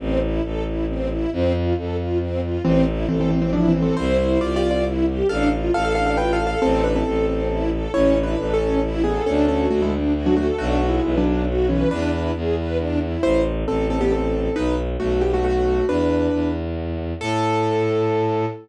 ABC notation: X:1
M:3/4
L:1/16
Q:1/4=136
K:Am
V:1 name="Acoustic Grand Piano"
z12 | z12 | [E,C]2 z2 [E,C] [E,C] [E,C] [E,C] (3[F,D]2 [E,C]2 [E,C]2 | [Ec]4 (3[Fd]2 [Fd]2 [Fd]2 z4 |
[Af]2 z2 [Af] [Af] [Af] [Af] (3[Bg]2 [Af]2 [Af]2 | [CA]2 [DB] [CA]7 z2 | [K:A] (3[Ec]4 [DB]4 [CA]4 z2 [B,G]2 | [CA]2 [CA]2 [A,F] [G,E] z3 [F,D] [A,F] z |
(3[A,F]4 [G,E]4 [F,D]4 z2 [E,C]2 | [DB] [DB]3 z8 | [K:Am] [Ec]2 z2 [CA]2 [CA] [B,G] [CA]4 | [^DB]2 z2 [A,^F]2 [B,G] [A,F] [A,F]4 |
[DB]6 z6 | A12 |]
V:2 name="String Ensemble 1"
C2 E2 A2 E2 C2 E2 | C2 F2 A2 F2 C2 F2 | C2 E2 A2 C2 E2 A2 | C2 E2 G2 C2 E2 G2 |
D2 F2 A2 D2 F2 A2 | C2 E2 A2 C2 E2 A2 | [K:A] C2 E2 A2 C2 E2 A2 | D2 F2 A2 D2 F2 A2 |
D2 F2 B2 D2 F2 B2 | D2 E2 G2 B2 D2 E2 | [K:Am] z12 | z12 |
z12 | z12 |]
V:3 name="Violin" clef=bass
A,,,4 A,,,8 | F,,4 F,,8 | A,,,4 A,,,8 | C,,4 C,,8 |
A,,,4 A,,,8 | A,,,4 A,,,8 | [K:A] A,,,4 A,,,8 | D,,4 D,,8 |
B,,,4 B,,,8 | E,,4 E,,8 | [K:Am] A,,,4 A,,,8 | B,,,4 B,,,8 |
E,,4 E,,8 | A,,12 |]